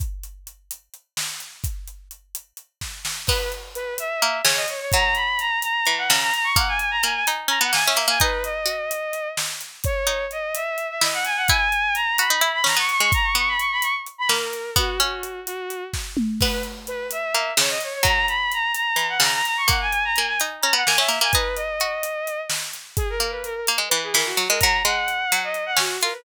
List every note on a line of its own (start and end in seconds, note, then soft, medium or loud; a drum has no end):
0.00 kick loud
0.00 closed hi-hat loud
0.23 closed hi-hat medium
0.47 closed hi-hat medium
0.71 closed hi-hat loud
0.94 closed hi-hat medium
1.17 snare loud
1.40 closed hi-hat medium
1.64 kick loud
1.64 closed hi-hat loud
1.88 closed hi-hat medium
2.11 closed hi-hat medium
2.35 closed hi-hat loud
2.57 closed hi-hat medium
2.81 kick medium
2.81 snare medium
3.05 snare loud
3.27 3.95 B3 medium
3.27 3.50 B4 medium
3.27 kick loud
3.27 crash loud
3.52 closed hi-hat medium
3.75 3.94 B4 medium
3.75 closed hi-hat medium
3.98 4.38 E5 medium
3.98 closed hi-hat loud
4.22 4.42 A#3 medium
4.22 closed hi-hat medium
4.45 4.66 C#3 medium
4.45 4.56 C#5 medium
4.45 snare loud
4.56 4.67 D#5 medium
4.68 4.79 C#5 medium
4.68 closed hi-hat medium
4.81 4.92 C#5 medium
4.92 5.59 F#3 medium
4.92 5.14 A#5 medium
4.92 kick loud
4.92 closed hi-hat loud
5.15 5.38 B5 medium
5.15 closed hi-hat medium
5.39 5.59 A#5 medium
5.39 closed hi-hat medium
5.62 5.93 A#5 medium
5.62 closed hi-hat loud
5.86 6.09 E3 medium
5.86 closed hi-hat medium
5.98 6.09 F#5 medium
6.08 6.32 C#3 medium
6.08 6.19 A#5 medium
6.08 snare loud
6.22 6.33 A#5 medium
6.34 6.45 A#5 medium
6.34 closed hi-hat medium
6.44 6.55 C#6 medium
6.56 6.98 A#3 medium
6.56 6.67 F#5 medium
6.56 kick loud
6.56 closed hi-hat loud
6.68 6.79 G#5 medium
6.79 6.90 G#5 medium
6.79 closed hi-hat medium
6.91 7.02 A#5 medium
7.03 7.25 A#3 medium
7.03 7.14 G#5 medium
7.03 closed hi-hat medium
7.15 7.26 G#5 medium
7.27 7.49 D#4 medium
7.27 closed hi-hat loud
7.48 7.59 C#4 medium
7.48 7.60 A#5 medium
7.48 closed hi-hat medium
7.61 7.72 B3 medium
7.61 7.72 F#5 medium
7.73 7.84 A#3 medium
7.73 7.84 G#5 medium
7.73 snare loud
7.85 7.99 C#4 medium
7.85 8.05 E5 medium
7.96 8.07 A#3 medium
7.96 closed hi-hat medium
8.08 8.19 A#3 medium
8.08 8.20 G#5 medium
8.20 8.66 D#4 loud
8.20 8.43 B4 medium
8.20 kick loud
8.20 closed hi-hat loud
8.44 9.28 D#5 medium
8.44 closed hi-hat medium
8.66 9.31 F#4 medium
8.66 closed hi-hat medium
8.91 closed hi-hat loud
9.13 closed hi-hat medium
9.37 snare loud
9.61 closed hi-hat medium
9.84 10.25 C#5 medium
9.84 kick loud
9.84 closed hi-hat loud
10.07 10.27 D#4 medium
10.07 closed hi-hat medium
10.31 10.54 D#5 medium
10.31 closed hi-hat medium
10.55 10.87 E5 medium
10.55 closed hi-hat loud
10.78 closed hi-hat medium
10.90 11.01 E5 medium
11.01 11.41 E4 medium
11.01 11.13 D#5 medium
11.01 snare loud
11.13 11.25 F#5 medium
11.25 11.36 G#5 medium
11.25 closed hi-hat medium
11.36 11.48 F#5 medium
11.48 11.70 E4 medium
11.48 11.94 G#5 medium
11.48 kick loud
11.48 closed hi-hat loud
11.72 closed hi-hat medium
11.95 12.16 A#5 medium
11.95 closed hi-hat medium
12.18 12.30 F#4 medium
12.18 12.49 B5 medium
12.18 closed hi-hat loud
12.30 12.41 D#4 medium
12.41 12.62 E4 medium
12.41 closed hi-hat medium
12.54 12.65 B5 medium
12.64 12.75 C#4 medium
12.64 12.77 A#5 medium
12.64 snare loud
12.77 12.98 B3 medium
12.77 12.89 C#6 medium
12.89 13.01 C#6 medium
12.89 closed hi-hat medium
13.00 13.12 G#3 medium
13.00 13.12 C#6 medium
13.12 13.25 A#5 medium
13.12 kick loud
13.12 closed hi-hat loud
13.24 13.35 C#6 medium
13.35 13.56 B3 medium
13.35 13.49 C#6 medium
13.35 closed hi-hat medium
13.48 13.59 B5 medium
13.59 13.71 C#6 medium
13.59 closed hi-hat medium
13.72 13.83 B5 medium
13.82 13.94 C#6 medium
13.82 closed hi-hat loud
14.06 closed hi-hat medium
14.18 14.29 B5 medium
14.29 14.71 A#3 medium
14.29 14.70 A#4 medium
14.29 snare loud
14.53 closed hi-hat medium
14.76 14.98 B3 medium
14.76 14.99 F#4 medium
14.76 kick loud
14.76 closed hi-hat loud
15.00 15.44 C#4 medium
15.00 15.40 F#4 medium
15.00 closed hi-hat medium
15.23 closed hi-hat medium
15.46 15.84 F#4 medium
15.46 closed hi-hat loud
15.70 closed hi-hat medium
15.93 kick medium
15.93 snare medium
16.17 mid tom loud
16.41 17.09 B3 medium
16.41 16.62 B4 medium
16.41 kick loud
16.41 crash loud
16.63 closed hi-hat medium
16.87 17.07 B4 medium
16.87 closed hi-hat medium
17.11 17.51 E5 medium
17.11 closed hi-hat loud
17.34 17.54 A#3 medium
17.34 closed hi-hat medium
17.57 17.79 C#3 medium
17.57 17.70 C#5 medium
17.57 snare loud
17.69 17.81 D#5 medium
17.81 17.93 C#5 medium
17.81 closed hi-hat medium
17.94 18.05 C#5 medium
18.03 18.68 F#3 medium
18.03 18.25 A#5 medium
18.03 kick loud
18.03 closed hi-hat loud
18.28 18.51 B5 medium
18.28 closed hi-hat medium
18.52 18.72 A#5 medium
18.52 closed hi-hat medium
18.75 19.06 A#5 medium
18.75 closed hi-hat loud
18.96 19.18 E3 medium
18.96 closed hi-hat medium
19.09 19.20 F#5 medium
19.20 19.42 C#3 medium
19.20 19.33 A#5 medium
19.20 snare loud
19.34 19.45 A#5 medium
19.45 19.56 A#5 medium
19.45 closed hi-hat medium
19.57 19.68 C#6 medium
19.68 20.09 A#3 medium
19.68 19.80 F#5 medium
19.68 kick loud
19.68 closed hi-hat loud
19.81 19.92 G#5 medium
19.92 20.04 G#5 medium
19.92 closed hi-hat medium
20.05 20.16 A#5 medium
20.15 20.39 A#3 medium
20.15 20.26 G#5 medium
20.15 closed hi-hat medium
20.27 20.38 G#5 medium
20.40 20.62 D#4 medium
20.40 closed hi-hat loud
20.61 20.74 C#4 medium
20.61 20.72 A#5 medium
20.61 closed hi-hat medium
20.73 20.84 B3 medium
20.73 20.86 F#5 medium
20.86 20.99 A#3 medium
20.86 20.97 G#5 medium
20.86 snare loud
20.98 21.09 C#4 medium
20.98 21.18 E5 medium
21.08 21.20 A#3 medium
21.08 closed hi-hat medium
21.21 21.32 A#3 medium
21.21 21.33 G#5 medium
21.32 21.79 D#4 loud
21.32 21.55 B4 medium
21.32 kick loud
21.32 closed hi-hat loud
21.56 22.40 D#5 medium
21.56 closed hi-hat medium
21.80 22.46 F#4 medium
21.80 closed hi-hat medium
22.03 closed hi-hat loud
22.27 closed hi-hat medium
22.50 snare loud
22.73 closed hi-hat medium
22.97 23.08 G#4 medium
22.97 kick loud
22.97 closed hi-hat loud
23.10 23.19 A#4 medium
23.20 23.61 A#3 medium
23.20 23.31 A#4 medium
23.20 closed hi-hat medium
23.31 23.42 B4 medium
23.44 23.54 A#4 medium
23.44 closed hi-hat medium
23.55 23.66 A#4 medium
23.67 23.79 A#3 medium
23.67 closed hi-hat loud
23.78 23.89 G#3 medium
23.89 24.14 E3 medium
23.89 24.00 B4 medium
23.89 closed hi-hat medium
24.03 24.14 G#4 medium
24.14 24.36 E3 medium
24.14 24.25 A#4 medium
24.14 snare loud
24.26 24.46 F#4 medium
24.37 24.48 F#3 medium
24.37 closed hi-hat medium
24.49 24.61 G#3 medium
24.49 24.60 A#4 medium
24.60 24.83 F#3 medium
24.60 24.80 A#5 medium
24.60 kick loud
24.60 closed hi-hat loud
24.85 25.25 G#3 medium
24.85 25.39 F#5 medium
24.85 closed hi-hat medium
25.08 closed hi-hat medium
25.32 25.78 F#3 medium
25.32 closed hi-hat loud
25.44 25.64 D#5 medium
25.54 closed hi-hat medium
25.66 25.77 F#5 medium
25.77 25.97 C#4 medium
25.77 25.98 F#4 medium
25.77 snare loud
26.01 26.14 F4 medium
26.01 26.13 A#4 medium
26.01 closed hi-hat medium
26.12 26.24 B4 medium